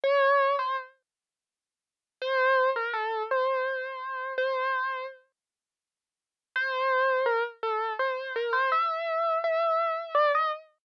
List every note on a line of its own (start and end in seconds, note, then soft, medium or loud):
0.03 0.56 C#5 loud
0.59 0.76 C5 loud
2.21 2.70 C5 loud
2.76 2.93 A#4 medium
2.93 3.23 A4 medium
3.31 4.33 C5 medium
4.38 5.06 C5 loud
6.56 7.25 C5 loud
7.26 7.43 A#4 loud
7.63 7.93 A4 medium
7.99 8.33 C5 medium
8.36 8.53 A#4 loud
8.53 8.70 C5 loud
8.72 9.38 E5 loud
9.44 10.14 E5 medium
10.14 10.32 D5 loud
10.34 10.52 D#5 loud